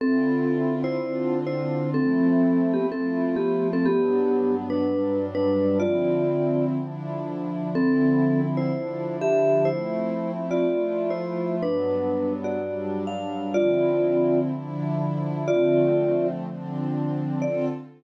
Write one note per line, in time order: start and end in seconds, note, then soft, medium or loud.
0.00 0.96 D3 medium
0.00 0.96 C4 medium
0.00 0.74 C4 loud
0.00 0.96 E4 medium
0.00 0.96 F4 medium
0.00 0.74 A4 loud
0.84 1.39 E4 medium
0.84 1.39 C5 loud
0.97 1.93 D3 medium
0.97 1.93 C4 medium
0.97 1.93 D4 medium
0.97 1.93 F4 medium
1.47 1.90 E4 medium
1.47 1.90 C5 medium
1.93 2.90 F3 medium
1.93 2.90 A3 medium
1.93 2.90 C4 medium
1.93 2.72 C4 medium
1.93 2.90 E4 medium
1.93 2.72 A4 loud
2.73 2.87 B3 medium
2.73 2.87 G4 medium
2.90 3.86 F3 medium
2.90 3.86 A3 medium
2.90 3.36 C4 medium
2.90 3.86 E4 medium
2.90 3.86 F4 medium
2.90 3.36 A4 medium
3.36 3.68 B3 medium
3.36 3.68 G4 medium
3.73 3.87 C4 medium
3.73 3.87 A4 loud
3.86 4.83 G2 medium
3.86 4.83 F#3 medium
3.86 4.56 B3 medium
3.86 4.83 B3 medium
3.86 4.83 D4 medium
3.86 4.56 G4 loud
4.70 5.25 D4 medium
4.70 5.25 B4 medium
4.84 5.80 G2 medium
4.84 5.80 F#3 medium
4.84 5.80 G3 medium
4.84 5.80 D4 medium
5.35 5.78 D4 medium
5.35 5.78 B4 loud
5.80 6.77 D3 medium
5.80 6.77 F3 medium
5.80 6.77 C4 medium
5.80 6.77 E4 medium
5.80 6.65 F4 medium
5.80 6.65 D5 loud
6.77 7.74 D3 medium
6.77 7.74 F3 medium
6.77 7.74 D4 medium
6.77 7.74 E4 medium
7.74 8.70 D3 medium
7.74 8.70 F3 medium
7.74 8.70 C4 medium
7.74 8.41 C4 loud
7.74 8.70 E4 medium
7.74 8.41 A4 loud
8.57 9.16 E4 medium
8.57 9.16 C5 medium
8.71 9.67 D3 medium
8.71 9.67 F3 medium
8.71 9.67 D4 medium
8.71 9.67 E4 medium
9.21 9.68 G4 medium
9.21 9.68 E5 medium
9.65 10.64 F3 medium
9.65 10.64 A3 medium
9.65 10.64 C4 medium
9.65 10.32 E4 medium
9.65 10.64 E4 medium
9.65 10.32 C5 medium
10.51 11.11 F4 medium
10.51 11.11 D5 medium
10.65 11.61 F3 medium
10.65 11.61 A3 medium
10.65 11.61 E4 medium
10.65 11.61 F4 medium
11.10 11.56 E4 medium
11.10 11.56 C5 medium
11.61 12.57 G2 medium
11.61 12.57 F#3 medium
11.61 12.57 B3 medium
11.61 12.57 D4 medium
11.61 12.33 D4 medium
11.61 12.33 B4 medium
12.44 13.03 F#4 medium
12.44 13.03 D5 medium
12.58 13.54 G2 medium
12.58 13.54 F#3 medium
12.58 13.54 G3 medium
12.58 13.54 D4 medium
13.07 13.55 F5 medium
13.54 14.51 D3 medium
13.54 14.51 F3 medium
13.54 14.51 C4 medium
13.54 14.51 E4 medium
13.54 14.40 F4 loud
13.54 14.40 D5 loud
14.52 15.48 D3 medium
14.52 15.48 F3 medium
14.52 15.48 D4 medium
14.52 15.48 E4 loud
15.48 16.44 D3 medium
15.48 16.44 F3 medium
15.48 16.44 A3 medium
15.48 16.44 C4 medium
15.48 16.27 F4 loud
15.48 16.27 D5 loud
16.45 17.41 D3 medium
16.45 17.41 F3 medium
16.45 17.41 C4 medium
16.45 17.41 D4 medium
17.42 17.65 D3 loud
17.42 17.65 C4 loud
17.42 17.65 F4 loud
17.42 17.65 A4 loud
17.42 17.65 D5 loud